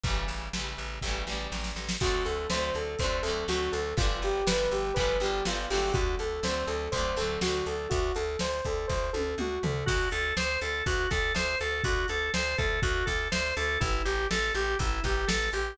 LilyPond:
<<
  \new Staff \with { instrumentName = "Lead 2 (sawtooth)" } { \time 4/4 \key d \mixolydian \tempo 4 = 122 r1 | fis'8 a'8 c''8 a'8 c''8 a'8 fis'8 a'8 | f'8 g'8 b'8 g'8 b'8 g'8 f'8 g'8 | fis'8 a'8 c''8 a'8 c''8 a'8 fis'8 a'8 |
fis'8 a'8 c''8 a'8 c''8 a'8 fis'8 a'8 | \key a \mixolydian r1 | r1 | r1 | }
  \new Staff \with { instrumentName = "Drawbar Organ" } { \time 4/4 \key d \mixolydian r1 | r1 | r1 | r1 |
r1 | \key a \mixolydian fis'8 a'8 c''8 a'8 fis'8 a'8 c''8 a'8 | fis'8 a'8 c''8 a'8 fis'8 a'8 c''8 a'8 | e'8 g'8 a'8 g'8 e'8 g'8 a'8 g'8 | }
  \new Staff \with { instrumentName = "Acoustic Guitar (steel)" } { \time 4/4 \key d \mixolydian <cis e g a>4 <cis e g a>4 <cis e g a>8 <cis e g a>4. | <d fis a c'>4 <d fis a c'>4 <d fis a c'>8 <d fis a c'>8 <d fis a c'>4 | <d f g b>4 <d f g b>4 <d f g b>8 <d f g b>8 <d f g b>8 <d fis a c'>8~ | <d fis a c'>4 <d fis a c'>4 <d fis a c'>8 <d fis a c'>8 <d fis a c'>4 |
r1 | \key a \mixolydian r1 | r1 | r1 | }
  \new Staff \with { instrumentName = "Electric Bass (finger)" } { \clef bass \time 4/4 \key d \mixolydian a,,8 a,,8 a,,8 a,,8 a,,8 a,,8 a,,8 a,,8 | d,8 d,8 d,8 d,8 d,8 d,8 d,8 d,8 | g,,8 g,,8 g,,8 g,,8 g,,8 g,,8 g,,8 g,,8 | d,8 d,8 d,8 d,8 d,8 d,8 d,8 d,8 |
d,8 d,8 d,8 d,8 d,8 d,8 d,8 d,8 | \key a \mixolydian d,8 d,8 d,8 d,8 d,8 d,8 d,8 d,8 | d,8 d,8 d,8 d,8 d,8 d,8 d,8 d,8 | a,,8 a,,8 a,,8 a,,8 a,,8 a,,8 a,,8 a,,8 | }
  \new DrumStaff \with { instrumentName = "Drums" } \drummode { \time 4/4 <hh bd>4 sn4 <bd sn>8 sn8 sn16 sn16 sn16 sn16 | <cymc bd>8 hh8 sn8 hh8 <hh bd>8 hh8 sn8 hh8 | <hh bd>8 hh8 sn8 hh8 <hh bd>8 hh8 sn8 hho8 | <hh bd>8 hh8 sn8 hh8 <hh bd>8 hh8 sn8 hh8 |
<hh bd>8 hh8 sn8 <hh bd>8 <bd sn>8 tommh8 toml8 tomfh8 | <cymc bd>8 hh8 sn8 hh8 <hh bd>8 <hh bd sn>8 sn8 hh8 | <hh bd>8 hh8 sn8 <hh bd>8 <hh bd>8 <hh bd sn>8 sn8 hh8 | <hh bd>8 hh8 sn8 hh8 <hh bd>8 <hh bd sn>8 sn8 hh8 | }
>>